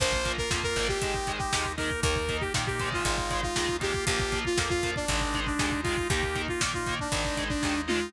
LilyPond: <<
  \new Staff \with { instrumentName = "Lead 2 (sawtooth)" } { \time 4/4 \key bes \mixolydian \tempo 4 = 118 c''8. bes'16 r16 bes'8 g'4 g'8. bes'8 | bes'8. g'16 r16 g'8 f'4 f'8. g'8 | g'8. f'16 r16 f'8 d'4 d'8. f'8 | g'8. f'16 r16 f'8 d'4 d'8. f'8 | }
  \new Staff \with { instrumentName = "Overdriven Guitar" } { \time 4/4 \key bes \mixolydian <f bes>8 <f bes>8 <f bes>8 <f bes>8 <ees aes>8 <ees aes>8 <ees aes>8 <ees aes>8 | <ees bes>8 <ees bes>8 <ees bes>8 <ees aes>4 <ees aes>8 <ees aes>8 <ees aes>8 | <f bes>8 <f bes>8 <f bes>8 <f bes>8 <ees aes>8 <ees aes>8 <ees aes>8 <ees aes>8 | <ees bes>8 <ees bes>8 <ees bes>8 <ees bes>8 <ees aes>8 <ees aes>8 <ees aes>8 <ees aes>8 | }
  \new Staff \with { instrumentName = "Drawbar Organ" } { \time 4/4 \key bes \mixolydian <bes f'>2 <aes ees'>4. <bes ees'>8~ | <bes ees'>2 <aes ees'>4. <bes f'>8~ | <bes f'>2 <aes ees'>2 | <bes ees'>2 <aes ees'>2 | }
  \new Staff \with { instrumentName = "Electric Bass (finger)" } { \clef bass \time 4/4 \key bes \mixolydian bes,,4 f,8 aes,,4. ees,4 | ees,4 bes,4 aes,,4 ees,4 | bes,,4 f,4 aes,,4 ees,4 | ees,4 bes,4 aes,,4 ees,4 | }
  \new DrumStaff \with { instrumentName = "Drums" } \drummode { \time 4/4 <cymc bd>16 bd16 <hh bd>16 bd16 <bd sn>16 bd16 <hh bd>16 bd16 <hh bd>16 bd16 <hh bd>16 bd16 <bd sn>16 bd16 <hho bd>16 bd16 | <hh bd>16 bd16 <hh bd>16 bd16 <bd sn>16 bd16 <hh bd>16 bd16 <hh bd>16 bd16 <hh bd>16 bd16 <bd sn>16 bd16 <hh bd>16 bd16 | <hh bd>16 bd16 <hh bd>16 bd16 <bd sn>16 bd16 <hh bd>16 bd16 <hh bd>16 bd16 <hh bd>16 bd16 <bd sn>16 bd16 <hho bd>16 bd16 | <hh bd>16 bd16 <hh bd>16 bd16 <bd sn>16 bd16 <hh bd>16 bd16 <hh bd>16 bd16 <hh bd>16 bd16 <bd sn>8 toml8 | }
>>